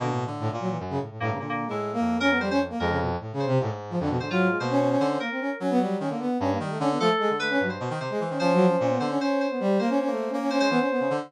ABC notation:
X:1
M:7/8
L:1/16
Q:1/4=150
K:none
V:1 name="Brass Section"
D, A,,3 A,, ^A,, ^F, E, z ^C, =A,, A,, A,, C, | (3D,4 ^G,4 ^A,4 ^C B, =G, C z A, | ^G, ^C, B,, z (3A,,2 C,2 =C,2 A,, z2 F, D, B,, | D, ^F,2 ^G, ^A, ^C C C2 C A, =C ^C z |
^C B, G,2 C ^A, B,2 C A, G, =A, C B, | A, z ^G, z A, ^C ^F, z4 G, z C | (3^C2 ^F,2 C2 C B,2 C C3 B, G,2 | ^A, ^C C =A,2 C C C2 B, C B, C z |]
V:2 name="Electric Piano 2"
^A,2 z10 A,2 | ^A, A,2 E5 ^A2 c c z2 | ^A2 z4 c2 z6 | c F3 c4 c2 ^A4 |
z14 | A4 B3 c3 c4 | c6 c z c2 c4 | c6 z c c6 |]
V:3 name="Brass Section"
(3B,,4 D,4 ^A,,4 ^F,,2 z2 G,,2 | ^A,,3 =A,,3 F,,8 | F,,4 z4 ^G,,4 F,,2 | ^G,,4 B,,4 D,2 z4 |
^F,4 ^D, =D,2 z G,,2 ^D,2 =D,2 | F, z2 D,3 G,,2 B,, ^D, C, z E, D, | F,4 ^A,,2 D,2 z6 | (3^A,4 A,4 A,4 ^G, E, z2 ^C, D, |]